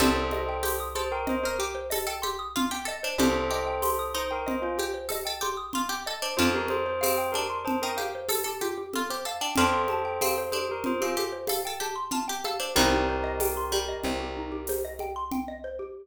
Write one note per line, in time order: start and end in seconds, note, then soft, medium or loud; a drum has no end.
0.00 2.93 C2 medium
0.00 0.14 G4 medium
0.00 0.57 A4 medium
0.00 0.78 A4 medium
0.00 0.57 C5 loud
0.00 0.78 C5 medium
0.00 low conga medium
0.15 0.30 C5 medium
0.31 0.47 D#5 medium
0.31 high conga medium
0.49 0.63 G5 medium
0.63 0.94 G4 medium
0.63 0.79 C6 medium
0.63 tambourine medium
0.63 high conga medium
0.80 0.94 D#6 medium
0.95 1.23 A4 medium
0.95 1.11 C5 medium
0.95 1.10 C6 medium
0.95 high conga medium
1.12 1.27 A#4 medium
1.12 1.26 G5 medium
1.27 1.44 C5 medium
1.27 1.41 D#5 medium
1.27 low conga medium
1.43 1.59 A#4 medium
1.43 1.61 A#4 medium
1.43 1.58 C5 medium
1.59 1.73 G4 medium
1.59 1.88 G4 medium
1.75 1.89 C5 medium
1.90 2.06 A4 medium
1.90 2.05 D#5 medium
1.90 tambourine medium
1.90 high conga medium
2.07 2.21 A4 medium
2.07 2.21 G5 medium
2.22 2.52 G4 medium
2.22 2.37 C6 medium
2.22 high conga medium
2.39 2.53 D#6 medium
2.56 2.70 F4 medium
2.56 2.70 C6 medium
2.56 low conga medium
2.71 2.86 G4 medium
2.71 2.86 G5 medium
2.85 3.00 A4 medium
2.85 3.02 D#5 medium
3.03 3.18 D4 medium
3.03 3.18 C5 medium
3.18 6.12 C2 medium
3.18 3.33 G4 medium
3.18 3.49 G4 medium
3.18 4.04 A4 medium
3.18 4.04 C5 medium
3.18 low conga medium
3.34 3.49 C5 medium
3.51 4.09 G4 medium
3.51 3.65 D#5 medium
3.67 3.81 G5 medium
3.82 3.97 C6 medium
3.82 tambourine medium
3.82 high conga medium
3.99 4.13 D#6 medium
4.14 4.75 D#4 medium
4.14 4.31 C5 medium
4.14 4.28 C6 medium
4.31 4.47 A#4 medium
4.31 4.45 G5 medium
4.47 4.63 C5 medium
4.47 4.61 D#5 medium
4.47 low conga medium
4.62 4.77 F4 medium
4.62 4.77 C5 medium
4.78 4.92 G4 medium
4.78 5.08 G4 medium
4.78 high conga medium
4.94 5.08 C5 medium
5.09 5.23 A4 medium
5.09 5.26 D#5 medium
5.09 tambourine medium
5.09 high conga medium
5.25 5.41 A4 medium
5.25 5.40 G5 medium
5.41 5.70 G4 medium
5.41 5.57 C6 medium
5.41 high conga medium
5.57 5.72 D#6 medium
5.73 5.89 F4 medium
5.73 5.88 C6 medium
5.73 low conga medium
5.89 6.04 G4 medium
5.89 6.04 G5 medium
6.06 6.22 A4 medium
6.06 6.21 D#5 medium
6.22 6.37 D4 medium
6.22 6.37 C5 medium
6.37 9.33 F2 medium
6.37 6.96 D4 medium
6.37 6.52 F4 medium
6.37 6.96 F4 medium
6.37 6.52 C5 medium
6.37 low conga medium
6.54 6.68 G4 medium
6.54 6.70 A#4 medium
6.68 6.85 A4 medium
6.68 6.99 C5 medium
6.68 high conga medium
6.86 7.00 C5 medium
7.01 7.33 C4 medium
7.01 7.29 C5 medium
7.01 7.15 F5 medium
7.01 tambourine medium
7.01 high conga medium
7.18 7.32 G5 medium
7.32 7.64 D4 medium
7.32 7.58 A#4 medium
7.32 7.49 A5 medium
7.32 high conga medium
7.50 7.64 C6 medium
7.65 7.80 C5 medium
7.65 7.80 A5 medium
7.65 low conga medium
7.82 7.98 D#4 medium
7.82 7.97 A#4 medium
7.82 7.97 G5 medium
7.97 8.26 G4 medium
7.97 8.12 F5 medium
7.97 high conga medium
8.15 8.29 C5 medium
8.29 8.43 A4 medium
8.29 8.44 A4 medium
8.29 tambourine medium
8.29 high conga medium
8.44 8.60 G4 medium
8.44 8.59 A4 medium
8.61 8.76 F4 medium
8.61 8.90 G4 medium
8.61 high conga medium
8.78 8.92 G4 medium
8.93 9.10 F4 medium
8.93 9.08 A4 medium
8.93 low conga medium
9.10 9.25 G4 medium
9.10 9.24 C5 medium
9.25 9.40 A4 medium
9.25 9.41 F5 medium
9.41 9.56 D4 medium
9.41 9.55 G5 medium
9.56 12.51 F2 medium
9.56 10.11 D4 medium
9.56 10.11 F4 medium
9.56 10.39 A4 medium
9.56 10.39 C5 medium
9.56 9.73 A5 medium
9.56 low conga medium
9.73 9.88 C6 medium
9.88 10.04 A5 medium
9.88 high conga medium
10.05 10.19 G5 medium
10.21 10.47 C4 medium
10.21 10.36 F5 medium
10.21 tambourine medium
10.21 high conga medium
10.38 10.52 C5 medium
10.52 10.84 D4 medium
10.52 10.67 A4 medium
10.52 10.67 C5 medium
10.52 high conga medium
10.69 10.83 G4 medium
10.69 10.86 A#4 medium
10.84 11.00 F4 medium
10.84 11.01 C5 medium
10.84 low conga medium
11.01 11.17 C4 medium
11.01 11.18 F4 medium
11.01 11.15 G4 medium
11.16 11.46 G4 medium
11.16 11.31 A4 medium
11.16 high conga medium
11.32 11.47 C5 medium
11.47 11.64 A4 medium
11.47 11.63 F5 medium
11.47 tambourine medium
11.47 high conga medium
11.65 11.81 A4 medium
11.65 11.80 G5 medium
11.80 12.09 G4 medium
11.80 11.96 A5 medium
11.80 high conga medium
11.96 12.10 C6 medium
12.11 12.26 F4 medium
12.11 12.27 A5 medium
12.11 low conga medium
12.28 12.44 G4 medium
12.28 12.42 G5 medium
12.44 12.59 A4 medium
12.44 12.59 F5 medium
12.44 high conga medium
12.60 12.74 D4 medium
12.60 12.74 C5 medium
12.76 13.95 C2 medium
12.76 13.62 D#3 medium
12.76 13.62 G3 loud
12.76 12.91 D#4 loud
12.76 14.73 G4 medium
12.76 14.73 A#4 medium
12.76 low conga medium
12.93 13.07 G4 medium
13.09 13.23 C5 medium
13.24 13.38 D#5 medium
13.40 13.55 G5 medium
13.40 tambourine medium
13.40 high conga medium
13.57 13.71 C6 medium
13.72 14.78 G3 medium
13.72 13.88 G5 medium
13.72 high conga medium
13.89 14.03 D#5 medium
14.03 15.80 C2 medium
14.03 14.19 C5 medium
14.03 low conga medium
14.20 14.34 G4 medium
14.37 14.51 D#4 medium
14.52 14.66 G4 medium
14.67 14.83 C5 medium
14.67 tambourine medium
14.67 high conga medium
14.85 14.99 D#5 medium
14.99 15.15 G5 medium
14.99 high conga medium
15.16 15.30 C6 medium
15.32 15.46 G5 medium
15.32 low conga medium
15.48 15.63 D#5 medium
15.64 15.78 C5 medium
15.79 15.94 G4 medium